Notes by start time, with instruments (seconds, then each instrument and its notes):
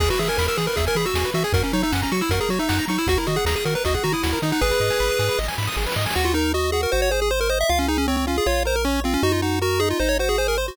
0.00 synth bass 1 E2, lead 1 (square) G#4, kick, crash
0.10 lead 1 (square) F#4 B4, closed hi-hat
0.19 synth bass 1 E3, lead 1 (square) G#4 E5, closed hi-hat
0.28 lead 1 (square) A#4 G#5, closed hi-hat
0.37 synth bass 1 E2, lead 1 (square) A#4 B5, snare
0.48 lead 1 (square) A#4 E6, closed hi-hat
0.57 synth bass 1 E3, lead 1 (square) G#4, closed hi-hat
0.67 lead 1 (square) A#4 B4, closed hi-hat
0.76 synth bass 1 E2, lead 1 (square) G#4 E5, kick, closed hi-hat
0.87 lead 1 (square) A#4 G#5, closed hi-hat
0.95 synth bass 1 E3, lead 1 (square) G#4 B5, closed hi-hat
1.06 lead 1 (square) F#4 E6, closed hi-hat
1.14 synth bass 1 E2, lead 1 (square) G#4, snare
1.25 lead 1 (square) B4, closed hi-hat
1.34 synth bass 1 E3, lead 1 (square) F#4 E5, closed hi-hat
1.44 lead 1 (square) G#4 G#5, closed hi-hat
1.53 synth bass 1 F#2, lead 1 (square) F#4 A#4, kick, closed hi-hat
1.63 lead 1 (square) C#4 A#4, closed hi-hat
1.72 synth bass 1 F#3, lead 1 (square) D#4 C#5, closed hi-hat
1.82 lead 1 (square) D#4 E5, closed hi-hat
1.92 synth bass 1 F#2, lead 1 (square) C#4 F#5, snare
2.02 lead 1 (square) C#4 A#5, kick, closed hi-hat
2.11 synth bass 1 F#3, lead 1 (square) F#4 C#6, closed hi-hat
2.21 lead 1 (square) E4 E6, closed hi-hat
2.29 synth bass 1 F#2, lead 1 (square) F#4 A#4, kick, closed hi-hat
2.40 lead 1 (square) G#4 A#4, closed hi-hat
2.49 synth bass 1 F#3, lead 1 (square) F#4 C#5, closed hi-hat
2.59 lead 1 (square) D#4 E5, closed hi-hat
2.69 synth bass 1 F#2, lead 1 (square) F#5, snare
2.79 lead 1 (square) A#5, closed hi-hat
2.88 synth bass 1 F#3, lead 1 (square) D#4 C#6, closed hi-hat
2.98 lead 1 (square) E4 E6, closed hi-hat
3.07 synth bass 1 D#2, lead 1 (square) F#4, kick, closed hi-hat
3.17 lead 1 (square) E4 A#4, closed hi-hat
3.27 synth bass 1 D#3, lead 1 (square) F#4 D#5, closed hi-hat
3.36 lead 1 (square) G#4 F#5, closed hi-hat
3.45 synth bass 1 D#2, lead 1 (square) G#4 A#5, snare
3.56 lead 1 (square) G#4 D#6, closed hi-hat
3.65 synth bass 1 D#3, lead 1 (square) F#4 A#4, closed hi-hat
3.75 lead 1 (square) A#4 B4, closed hi-hat
3.85 synth bass 1 D#2, lead 1 (square) F#4 D#5, kick, closed hi-hat
3.94 lead 1 (square) G#4 F#5, kick, closed hi-hat
4.04 synth bass 1 D#3, lead 1 (square) F#4 A#5, closed hi-hat
4.12 lead 1 (square) E4 D#6, closed hi-hat
4.23 synth bass 1 D#2, lead 1 (square) F#4, snare
4.33 lead 1 (square) A#4, closed hi-hat
4.42 synth bass 1 D#3, lead 1 (square) D#4 D#5, closed hi-hat
4.52 lead 1 (square) D#4 F#5, open hi-hat
4.61 synth bass 1 G#1, lead 1 (square) G#4 B4, kick, snare
4.71 lead 1 (square) B4, snare
4.80 synth bass 1 G#2, lead 1 (square) D#5, snare
4.90 lead 1 (square) G#5, snare
5.00 synth bass 1 G#1, lead 1 (square) B5, snare
5.10 lead 1 (square) D#6, snare
5.19 synth bass 1 G#2, lead 1 (square) G#4, snare
5.28 lead 1 (square) B4, snare
5.38 synth bass 1 G#1, lead 1 (square) D#5, snare
5.44 snare
5.48 lead 1 (square) G#5, snare
5.53 snare
5.58 synth bass 1 G#2, lead 1 (square) B5, snare
5.63 snare
5.67 lead 1 (square) D#6, snare
5.72 snare
5.77 synth bass 1 G#1, lead 1 (square) G#4, snare
5.82 snare
5.86 lead 1 (square) B4, snare
5.92 snare
5.96 synth bass 1 G#2, lead 1 (square) D#5, snare
6.01 snare
6.06 lead 1 (square) G#5, snare
6.10 snare
6.15 synth bass 1 D#2, lead 1 (square) F#4
6.25 lead 1 (square) F4
6.34 lead 1 (square) D#4 A#4
6.54 lead 1 (square) F#4 D#5
6.72 lead 1 (square) F#4 G#4
6.83 lead 1 (square) A#4
6.92 synth bass 1 G#1, lead 1 (square) F#4 C5
7.02 lead 1 (square) C#5
7.11 lead 1 (square) G#4 C5
7.22 lead 1 (square) G#4
7.31 lead 1 (square) C5
7.41 lead 1 (square) A#4
7.50 lead 1 (square) C5 D#5
7.61 lead 1 (square) E5
7.69 synth bass 1 C#2, lead 1 (square) F4 F5
7.79 lead 1 (square) C#4
7.88 lead 1 (square) D#4 G#4
7.98 lead 1 (square) C#4
8.08 lead 1 (square) C4 C#5
8.17 lead 1 (square) C4
8.27 lead 1 (square) C#4 F4
8.38 lead 1 (square) G#4
8.46 synth bass 1 A#1, lead 1 (square) F4 C#5
8.65 lead 1 (square) A#4 C5
8.76 lead 1 (square) A#4
8.85 lead 1 (square) C#4 C#5
9.04 lead 1 (square) C4 F4
9.14 lead 1 (square) C#4
9.23 synth bass 1 F#2, lead 1 (square) D#4 F#4
9.32 lead 1 (square) F4
9.42 lead 1 (square) D#4 F#4
9.62 lead 1 (square) F#4 A#4
9.80 lead 1 (square) D#4 G#4
9.90 lead 1 (square) F4
10.00 synth bass 1 G#1, lead 1 (square) D#4 C5
10.09 lead 1 (square) C#5
10.19 lead 1 (square) F#4 C5
10.29 lead 1 (square) G#4
10.38 lead 1 (square) G#4 C5
10.48 lead 1 (square) A#4
10.58 lead 1 (square) C5
10.68 lead 1 (square) F#4